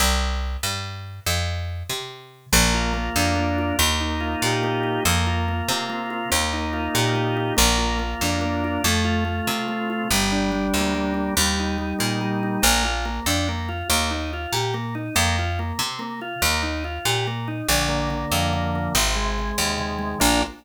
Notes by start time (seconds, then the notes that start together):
0.00 C2
0.63 G2
1.26 F2
1.89 C3
2.52 A#1 A#3
2.74 F4
2.94 A#3
3.16 F2 D4
3.36 A#3
3.58 F4
3.79 D#2 A#3
4.01 D#4
4.20 F4
4.42 A#2 G4
4.63 A#3
4.83 D#4
5.05 F2 A#3
5.27 F4
5.48 A#3
5.68 C3 C4
5.89 A#3
6.10 F4
6.32 D#2 A#3
6.53 D#4
6.73 F4
6.94 A#2 G4
7.16 A#3
7.37 D#4
7.57 A#1 A#3
7.78 F4
7.99 A#3
8.21 F2 D4
8.41 A#3
8.64 F4
8.84 F2 A3
9.05 F4
9.25 A3
9.47 C3 C4
9.68 A3
9.90 F4
10.11 G1 G3
10.32 D4
10.52 G3
10.74 D2 A#3
10.95 G3
11.14 D4
11.37 D#2 G3
11.59 D#4
11.78 G3
11.99 A#2 A#3
12.21 G3
12.43 D#4
12.62 A#1 A#3
12.85 F4
13.05 A#3
13.26 F2 D4
13.49 A#3
13.69 F4
13.90 D#2 A#3
14.10 D#4
14.33 F4
14.53 A#2 G4
14.74 A#3
14.95 D#4
15.15 F2 A#3
15.39 F4
15.59 A#3
15.79 C3 C4
15.99 A#3
16.21 F4
16.42 D#2 A#3
16.63 D#4
16.84 F4
17.05 A#2 G4
17.27 A#3
17.48 D#4
17.69 A#1 D3
17.89 A#3
18.10 D3
18.32 F2 F3
18.53 D3
18.75 A#3
18.95 G#1 C3
19.16 G#3
19.39 C3
19.58 D#2 D#3
19.78 C3
19.99 G#3
20.20 A#1 A#3 D4 F4